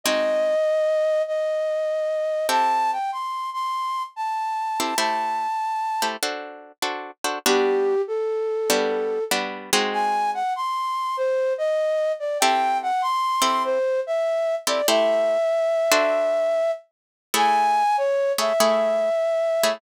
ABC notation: X:1
M:4/4
L:1/8
Q:"Swing" 1/4=97
K:G
V:1 name="Flute"
_e4 e4 | a g c' c'2 a3 | a4 z4 | G2 A4 z2 |
_a _g c'2 c _e2 d | g f c'2 c e2 d | e6 z2 | [K:A] g2 c e5 |]
V:2 name="Acoustic Guitar (steel)"
[_A,C_E_G]8 | [CEGA]7 [CEGA] | [A,EGc]3 [A,EGc] [DFAc]2 [DFAc] [DFAc] | [G,B,DF]4 [G,B,DF]2 [G,B,DF] [_A,C_E_G]- |
[_A,C_E_G]8 | [CEGA]3 [CEGA]4 [CEGA] | [A,EGc]3 [DFAc]5 | [K:A] [A,EGc]3 [A,EGc] [A,EGc]3 [A,EGc] |]